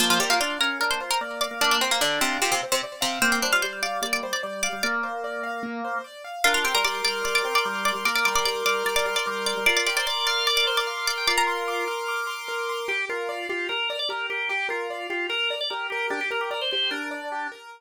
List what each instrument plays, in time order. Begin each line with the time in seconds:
0.00 pizzicato strings F3 F4, acoustic grand piano A#3, drawbar organ C5
0.10 pizzicato strings F3 F4
0.20 pizzicato strings G3 G4, drawbar organ A#4, acoustic grand piano C5
0.30 pizzicato strings A#3 A#4, drawbar organ F4
0.40 drawbar organ D4, pizzicato strings F4 F5, acoustic grand piano D5
0.59 drawbar organ C#4, pizzicato strings A#4 A#5, acoustic grand piano F5
0.80 acoustic grand piano A#3, drawbar organ D4, pizzicato strings A#4 A#5
0.91 pizzicato strings C5 C6
1.00 drawbar organ F4, acoustic grand piano C5
1.11 pizzicato strings A#4 A#5
1.21 drawbar organ A#3, acoustic grand piano D5
1.41 pizzicato strings D5 D6, acoustic grand piano F5
1.51 drawbar organ A#3
1.61 drawbar organ A#3, acoustic grand piano A#3, pizzicato strings D4 D5
1.71 pizzicato strings D4 D5
1.81 pizzicato strings C4 C5, acoustic grand piano C5
1.91 pizzicato strings A#3 A#4
2.01 pizzicato strings D3 D4, drawbar organ D4, acoustic grand piano D5
2.20 pizzicato strings C3 C4, acoustic grand piano F5
2.41 pizzicato strings C3 C4, acoustic grand piano A#3, drawbar organ F4
2.52 pizzicato strings C3 C4
2.63 acoustic grand piano C5
2.72 pizzicato strings C3 C4
2.83 acoustic grand piano D5
3.01 pizzicato strings C3 C4, acoustic grand piano F5
3.22 drawbar organ A#3, acoustic grand piano A#3, pizzicato strings C4 C5
3.32 pizzicato strings C4 C5
3.42 drawbar organ G3, pizzicato strings D4 D5, acoustic grand piano C5
3.52 drawbar organ G3, pizzicato strings F4 F5
3.62 drawbar organ G3, pizzicato strings C5 C6, acoustic grand piano D5
3.83 drawbar organ G3, pizzicato strings D5 D6, acoustic grand piano F5
4.02 drawbar organ G3, acoustic grand piano A#3, pizzicato strings D5 D6
4.13 pizzicato strings D5 D6
4.23 drawbar organ G3, acoustic grand piano C5
4.33 pizzicato strings D5 D6
4.43 drawbar organ G3, acoustic grand piano D5
4.63 pizzicato strings D5 D6, acoustic grand piano F5
4.73 drawbar organ G3
4.83 drawbar organ A#3, acoustic grand piano A#3, pizzicato strings D5 D6
5.04 acoustic grand piano C5
5.24 acoustic grand piano D5
5.43 acoustic grand piano F5
5.63 acoustic grand piano A#3
5.84 acoustic grand piano C5
6.04 acoustic grand piano D5
6.24 acoustic grand piano F5
6.44 drawbar organ D4, pizzicato strings F4 F5, acoustic grand piano A#4
6.54 pizzicato strings F4 F5
6.64 drawbar organ C4, pizzicato strings G4 G5, acoustic grand piano C6
6.75 drawbar organ G3, pizzicato strings A#4 A#5
6.84 drawbar organ G3, pizzicato strings D5 D6, acoustic grand piano D6
7.05 drawbar organ G3, pizzicato strings D5 D6, acoustic grand piano F6
7.24 drawbar organ G3, pizzicato strings D5 D6, acoustic grand piano D6
7.35 pizzicato strings D5 D6
7.44 drawbar organ C4, acoustic grand piano C6
7.55 pizzicato strings D5 D6
7.65 drawbar organ G3, acoustic grand piano A#4
7.85 pizzicato strings D5 D6, acoustic grand piano C6
7.95 drawbar organ G3
8.05 drawbar organ A#3, acoustic grand piano A#4, pizzicato strings D5 D6
8.16 pizzicato strings D5 D6
8.25 drawbar organ G3, pizzicato strings D5 D6, acoustic grand piano C6
8.35 drawbar organ G3, pizzicato strings D5 D6
8.45 drawbar organ G3, pizzicato strings D5 D6, acoustic grand piano D6
8.65 drawbar organ G3, pizzicato strings D5 D6, acoustic grand piano F6
8.86 drawbar organ G3, pizzicato strings D5 D6, acoustic grand piano D6
8.96 pizzicato strings D5 D6
9.06 drawbar organ G3, acoustic grand piano C6
9.16 pizzicato strings D5 D6
9.26 drawbar organ G3, acoustic grand piano A#4
9.46 pizzicato strings D5 D6, acoustic grand piano C6
9.57 drawbar organ G3
9.66 drawbar organ F4, acoustic grand piano A#4, pizzicato strings D5 D6
9.77 pizzicato strings D5 D6
9.86 drawbar organ G4, pizzicato strings D5 D6, acoustic grand piano C6
9.96 drawbar organ C5, pizzicato strings D5 D6
10.06 drawbar organ D5, pizzicato strings D5 D6, acoustic grand piano D6
10.27 pizzicato strings D5 D6, drawbar organ F5, acoustic grand piano F6
10.47 drawbar organ D5, pizzicato strings D5 D6, acoustic grand piano D6
10.57 pizzicato strings D5 D6
10.67 drawbar organ C5, acoustic grand piano C6
10.77 pizzicato strings D5 D6
10.87 acoustic grand piano A#4, drawbar organ F5
11.07 pizzicato strings D5 D6, acoustic grand piano C6
11.17 drawbar organ G5
11.27 drawbar organ F4, acoustic grand piano A#4, pizzicato strings D5 D6
11.38 pizzicato strings A#4 A#5
11.47 acoustic grand piano C6
11.68 acoustic grand piano D6
11.88 acoustic grand piano F6
12.08 acoustic grand piano D6
12.27 acoustic grand piano C6
12.48 acoustic grand piano A#4
12.69 acoustic grand piano C6
12.88 acoustic grand piano G4, drawbar organ G4
13.09 drawbar organ F4, acoustic grand piano A#4
13.29 acoustic grand piano D5
13.49 drawbar organ F4, acoustic grand piano G4
13.69 drawbar organ A#4, acoustic grand piano A#4
13.90 acoustic grand piano D5
13.99 drawbar organ D5
14.09 acoustic grand piano G4, drawbar organ A#4
14.30 drawbar organ G4, acoustic grand piano A#4
14.49 acoustic grand piano G4, drawbar organ G4
14.69 drawbar organ F4, acoustic grand piano A#4
14.90 acoustic grand piano D5
15.10 drawbar organ F4, acoustic grand piano G4
15.29 acoustic grand piano A#4, drawbar organ A#4
15.50 acoustic grand piano D5
15.61 drawbar organ D5
15.70 acoustic grand piano G4, drawbar organ A#4
15.90 drawbar organ G4, acoustic grand piano A#4
16.10 drawbar organ D4, acoustic grand piano G4
16.21 drawbar organ G4
16.31 acoustic grand piano A#4, drawbar organ A#4
16.41 drawbar organ G4
16.51 drawbar organ A#4, acoustic grand piano D5
16.61 drawbar organ C5
16.71 acoustic grand piano G4, drawbar organ C5
16.91 drawbar organ D4, acoustic grand piano A#4
17.11 acoustic grand piano D5
17.32 acoustic grand piano G4
17.52 acoustic grand piano A#4